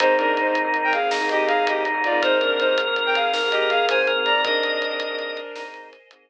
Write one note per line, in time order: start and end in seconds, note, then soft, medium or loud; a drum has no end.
0.00 4.10 G#1 medium
0.00 2.20 A#3 medium
0.00 2.20 C4 medium
0.00 0.15 C4 loud
0.00 0.15 D#4 medium
0.00 2.20 D#4 loud
0.00 0.95 D#4 loud
0.00 0.15 D#4 loud
0.00 2.20 G#4 medium
0.00 0.15 G#4 loud
0.00 0.15 A#4 medium
0.00 0.15 C5 loud
0.00 kick loud
0.00 closed hi-hat loud
0.17 0.41 C4 medium
0.17 0.34 D4 medium
0.17 0.41 D#4 medium
0.17 0.41 G#4 loud
0.17 0.34 A#4 medium
0.17 0.41 A#4 medium
0.17 closed hi-hat medium
0.37 0.54 D#4 medium
0.37 0.54 C5 medium
0.37 closed hi-hat medium
0.47 0.62 C4 medium
0.47 0.62 D#4 medium
0.47 0.62 G#4 medium
0.47 0.62 A#4 medium
0.55 closed hi-hat medium
0.64 0.94 C4 medium
0.64 0.94 D#4 medium
0.64 0.94 G#4 medium
0.64 0.94 A#4 medium
0.74 closed hi-hat medium
0.84 0.93 A#4 medium
0.84 0.93 G5 medium
0.93 1.10 G#4 medium
0.93 1.10 F5 medium
0.93 closed hi-hat medium
1.11 1.19 C4 medium
1.11 1.82 D#4 loud
1.11 1.19 D#4 medium
1.11 1.19 G#4 medium
1.11 1.19 A#4 medium
1.11 snare loud
1.21 1.51 C4 medium
1.21 1.51 D#4 medium
1.21 1.51 G#4 medium
1.21 1.51 A#4 loud
1.29 1.46 G4 medium
1.29 1.46 D#5 medium
1.29 closed hi-hat medium
1.47 1.65 G#4 medium
1.47 1.65 F5 medium
1.47 closed hi-hat medium
1.66 1.88 C4 medium
1.66 1.88 D#4 medium
1.66 1.83 G4 medium
1.66 1.88 G#4 medium
1.66 1.88 A#4 loud
1.66 1.83 D#5 medium
1.66 closed hi-hat loud
1.85 2.20 D#4 loud
1.85 closed hi-hat medium
1.94 2.09 C4 medium
1.94 2.09 D#4 medium
1.94 2.09 G#4 medium
1.94 2.09 A#4 medium
2.04 2.22 F4 medium
2.04 2.22 D5 medium
2.04 closed hi-hat medium
2.12 2.35 C4 medium
2.12 2.35 D#4 medium
2.12 2.35 G#4 medium
2.12 2.35 A#4 medium
2.22 4.42 G#3 loud
2.22 4.42 A#3 loud
2.22 4.42 C4 loud
2.22 2.38 D#4 medium
2.22 4.42 G#4 loud
2.22 3.29 A#4 loud
2.22 2.38 C5 loud
2.22 kick loud
2.22 closed hi-hat medium
2.40 2.62 C4 medium
2.40 2.58 D4 medium
2.40 2.62 D#4 medium
2.40 2.62 G#4 medium
2.40 2.62 A#4 medium
2.40 2.58 A#4 medium
2.40 closed hi-hat medium
2.60 2.75 D#4 medium
2.60 2.75 C5 medium
2.60 closed hi-hat medium
2.68 2.83 C4 medium
2.68 2.83 D#4 medium
2.68 2.83 G#4 medium
2.68 2.83 A#4 medium
2.78 closed hi-hat medium
2.87 3.17 C4 medium
2.87 3.17 D#4 medium
2.87 3.17 G#4 medium
2.87 3.17 A#4 medium
2.96 closed hi-hat medium
3.06 3.15 A#4 medium
3.06 3.15 G5 medium
3.15 3.31 G#4 medium
3.15 3.31 F5 medium
3.15 closed hi-hat medium
3.33 3.41 C4 medium
3.33 3.41 D#4 medium
3.33 3.41 G#4 medium
3.33 3.99 A#4 loud
3.33 3.41 A#4 medium
3.33 snare medium
3.42 3.72 C4 medium
3.42 3.72 D#4 medium
3.42 3.72 G#4 medium
3.42 3.72 A#4 medium
3.51 3.68 G4 medium
3.51 3.68 D#5 medium
3.51 closed hi-hat medium
3.70 3.86 G#4 medium
3.70 3.86 F5 medium
3.70 closed hi-hat medium
3.89 4.12 C4 medium
3.89 4.12 D#4 loud
3.89 4.12 G#4 medium
3.89 4.12 A#4 medium
3.89 4.07 C5 medium
3.89 4.07 G#5 medium
3.89 closed hi-hat loud
4.07 4.41 A#4 loud
4.07 closed hi-hat medium
4.16 4.31 C4 medium
4.16 4.31 D#4 medium
4.16 4.31 G#4 medium
4.16 4.31 A#4 medium
4.25 4.41 D5 medium
4.25 4.41 A#5 medium
4.25 closed hi-hat medium
4.35 4.43 C4 medium
4.35 4.43 D#4 medium
4.35 4.43 G#4 medium
4.35 4.43 A#4 medium
4.44 4.60 C4 loud
4.44 5.63 D4 medium
4.44 4.60 D#4 loud
4.44 4.60 G#4 loud
4.44 6.30 A#4 loud
4.44 5.63 A#4 medium
4.44 4.60 A#4 loud
4.44 6.30 C5 medium
4.44 6.30 D#5 medium
4.44 5.37 D#5 loud
4.44 6.30 G#5 medium
4.44 kick loud
4.44 closed hi-hat medium
4.63 4.85 C4 medium
4.63 4.85 D#4 medium
4.63 4.85 G#4 medium
4.63 4.85 A#4 medium
4.63 closed hi-hat medium
4.82 closed hi-hat medium
4.90 5.05 C4 medium
4.90 5.05 D#4 medium
4.90 5.05 G#4 medium
4.90 5.05 A#4 medium
5.00 closed hi-hat medium
5.10 5.40 C4 loud
5.10 5.40 D#4 medium
5.10 5.40 G#4 loud
5.10 5.40 A#4 medium
5.19 closed hi-hat medium
5.37 closed hi-hat medium
5.56 5.64 C4 medium
5.56 5.87 D#4 loud
5.56 5.64 D#4 medium
5.56 5.64 G#4 medium
5.56 5.64 A#4 medium
5.56 snare loud
5.65 5.94 C4 medium
5.65 5.94 D#4 medium
5.65 5.94 G#4 medium
5.65 5.94 A#4 loud
5.74 closed hi-hat medium
5.93 closed hi-hat medium
6.11 6.30 C4 medium
6.11 6.30 D#4 medium
6.11 6.30 G#4 medium
6.11 6.30 A#4 loud
6.11 closed hi-hat loud